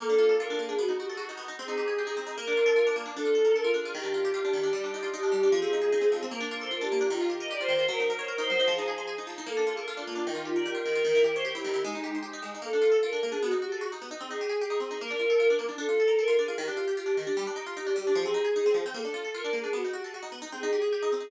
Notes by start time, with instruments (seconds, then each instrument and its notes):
0.00 orchestral harp A#3, choir aahs A4
0.09 orchestral harp D4
0.18 orchestral harp F4
0.29 orchestral harp A4
0.40 orchestral harp F4, choir aahs A#4
0.50 orchestral harp D4
0.59 orchestral harp A#3, choir aahs G#4
0.69 orchestral harp D4
0.78 orchestral harp B3, choir aahs F#4
0.89 orchestral harp D#4
0.98 orchestral harp F#4, choir aahs G4
1.09 choir aahs G#4, orchestral harp A4
1.17 orchestral harp F#4, choir aahs F#4
1.29 orchestral harp D#4
1.37 orchestral harp B3
1.48 orchestral harp D#4
1.57 orchestral harp C4, choir aahs G#4
1.68 orchestral harp D#4
1.78 orchestral harp G4
1.88 orchestral harp G#4
1.97 orchestral harp G4, choir aahs G#4
2.07 orchestral harp D#4
2.17 orchestral harp C4, choir aahs G#4
2.27 orchestral harp D#4
2.36 orchestral harp A#3, choir aahs A#4
2.47 orchestral harp D4
2.57 orchestral harp F4
2.66 orchestral harp A4
2.76 orchestral harp F4
2.87 orchestral harp D4
2.96 orchestral harp A#3
3.06 orchestral harp D4
3.16 orchestral harp D4, choir aahs A4
3.25 orchestral harp F4
3.35 orchestral harp A4
3.45 orchestral harp A#4
3.55 orchestral harp A4, choir aahs A#4
3.64 orchestral harp F4
3.74 orchestral harp D4, choir aahs G#4
3.85 orchestral harp F4
3.95 orchestral harp D#3, choir aahs G4
4.03 orchestral harp D4
4.14 orchestral harp F4
4.25 orchestral harp G4
4.34 orchestral harp F4, choir aahs G4
4.45 orchestral harp D4
4.53 orchestral harp D#3, choir aahs G4
4.63 orchestral harp D4
4.73 orchestral harp G3, choir aahs G4
4.84 orchestral harp D4
4.94 orchestral harp D#4
5.03 orchestral harp F4
5.13 orchestral harp D#4, choir aahs G4
5.23 orchestral harp D4
5.32 orchestral harp G3, choir aahs G4
5.43 orchestral harp D4
5.52 orchestral harp F3, choir aahs G#4
5.62 orchestral harp C4
5.73 orchestral harp D#4
5.82 orchestral harp G#4
5.92 orchestral harp D#4
6.01 orchestral harp C4
6.12 orchestral harp F3
6.23 orchestral harp C4
6.31 orchestral harp A#3, choir aahs A#4
6.41 orchestral harp D4
6.51 orchestral harp F4, choir aahs A#4
6.61 orchestral harp A4, choir aahs C5
6.71 orchestral harp F4, choir aahs A#4
6.81 orchestral harp D4, choir aahs G4
6.92 orchestral harp A#3
7.01 orchestral harp D4
7.10 orchestral harp D#3, choir aahs F4
7.21 orchestral harp F4
7.30 orchestral harp G4, choir aahs G4
7.40 orchestral harp A#4, choir aahs D#5
7.50 orchestral harp G4, choir aahs D5
7.60 orchestral harp F4, choir aahs C5
7.68 orchestral harp D#3
7.79 orchestral harp F4
7.88 orchestral harp F#3, choir aahs A#4
8.00 orchestral harp D#4
8.09 choir aahs A#4, orchestral harp A#4
8.19 choir aahs C5, orchestral harp C#5
8.28 orchestral harp A#4, choir aahs A#4
8.38 orchestral harp D#4, choir aahs C5
8.50 orchestral harp F#3
8.60 orchestral harp D#4
8.68 orchestral harp F3, choir aahs G#4
8.78 orchestral harp D#4
8.88 orchestral harp G#4
8.98 orchestral harp C5
9.07 orchestral harp G#4
9.18 orchestral harp D#4
9.27 orchestral harp F3
9.38 orchestral harp D#4
9.46 orchestral harp A#3, choir aahs A4
9.57 orchestral harp D4
9.67 orchestral harp F4, choir aahs G#4
9.77 orchestral harp A4, choir aahs A#4
9.87 orchestral harp F4, choir aahs A4
9.97 orchestral harp D4, choir aahs F4
10.07 orchestral harp A#3
10.15 orchestral harp D4
10.26 orchestral harp D#3, choir aahs D#4
10.35 orchestral harp F4
10.45 choir aahs F4, orchestral harp G4
10.56 orchestral harp A#4, choir aahs D5
10.66 orchestral harp G4, choir aahs A#4
10.75 orchestral harp F4, choir aahs A#4
10.86 orchestral harp D#3
10.95 orchestral harp F4
11.05 orchestral harp D#3, choir aahs A#4
11.15 orchestral harp E4
11.24 orchestral harp G4, choir aahs A#4
11.35 choir aahs C5, orchestral harp C#5
11.45 orchestral harp G4, choir aahs A#4
11.54 orchestral harp E4, choir aahs G4
11.65 orchestral harp D#3
11.74 orchestral harp E4
11.84 orchestral harp G#3, choir aahs D#4
11.95 orchestral harp D#4
12.04 orchestral harp G4
12.15 orchestral harp C5
12.23 orchestral harp G4
12.33 orchestral harp D#4
12.42 orchestral harp G#3
12.55 orchestral harp D#4
12.62 orchestral harp A#3, choir aahs A4
12.73 orchestral harp D4
12.82 orchestral harp F4
12.92 orchestral harp A4
13.03 orchestral harp F4, choir aahs A#4
13.13 orchestral harp D4
13.22 orchestral harp A#3, choir aahs G#4
13.32 orchestral harp D4
13.42 orchestral harp B3, choir aahs F#4
13.51 orchestral harp D#4
13.62 orchestral harp F#4, choir aahs G4
13.72 choir aahs G#4, orchestral harp A4
13.81 orchestral harp F#4, choir aahs F#4
13.92 orchestral harp D#4
14.02 orchestral harp B3
14.11 orchestral harp D#4
14.21 orchestral harp C4, choir aahs G#4
14.31 orchestral harp D#4
14.41 orchestral harp G4
14.49 orchestral harp G#4
14.60 orchestral harp G4, choir aahs G#4
14.70 orchestral harp D#4
14.80 orchestral harp C4, choir aahs G#4
14.91 orchestral harp D#4
15.00 orchestral harp A#3, choir aahs A#4
15.10 orchestral harp D4
15.19 orchestral harp F4
15.30 orchestral harp A4
15.40 orchestral harp F4
15.50 orchestral harp D4
15.59 orchestral harp A#3
15.69 orchestral harp D4
15.78 orchestral harp D4, choir aahs A4
15.89 orchestral harp F4
16.00 orchestral harp A4
16.08 orchestral harp A#4
16.19 orchestral harp A4, choir aahs A#4
16.28 orchestral harp F4
16.38 orchestral harp D4, choir aahs G#4
16.48 orchestral harp F4
16.58 orchestral harp D#3, choir aahs G4
16.68 orchestral harp D4
16.77 orchestral harp F4
16.88 orchestral harp G4
16.97 orchestral harp F4, choir aahs G4
17.06 orchestral harp D4
17.17 orchestral harp D#3, choir aahs G4
17.27 orchestral harp D4
17.37 orchestral harp G3, choir aahs G4
17.47 orchestral harp D4
17.56 orchestral harp D#4
17.66 orchestral harp F4
17.76 orchestral harp D#4, choir aahs G4
17.87 orchestral harp D4
17.96 orchestral harp G3, choir aahs G4
18.07 orchestral harp D4
18.15 orchestral harp F3, choir aahs G#4
18.26 orchestral harp C4
18.34 orchestral harp D#4
18.45 orchestral harp G#4
18.56 orchestral harp D#4
18.66 orchestral harp C4
18.74 orchestral harp F3
18.86 orchestral harp C4
18.94 orchestral harp A#3, choir aahs A4
19.05 orchestral harp D4
19.14 orchestral harp F4
19.25 orchestral harp A4
19.34 orchestral harp F4, choir aahs A#4
19.44 orchestral harp D4
19.53 orchestral harp A#3, choir aahs G#4
19.64 orchestral harp D4
19.73 orchestral harp B3, choir aahs F#4
19.84 orchestral harp D#4
19.93 orchestral harp F#4, choir aahs G4
20.03 choir aahs G#4, orchestral harp A4
20.13 choir aahs F#4, orchestral harp F#4
20.23 orchestral harp D#4
20.32 orchestral harp B3
20.42 orchestral harp D#4
20.52 orchestral harp C4, choir aahs G#4
20.63 orchestral harp D#4
20.73 orchestral harp G4
20.82 orchestral harp G#4
20.92 orchestral harp G4, choir aahs G#4
21.03 orchestral harp D#4
21.12 orchestral harp C4, choir aahs G#4
21.20 orchestral harp D#4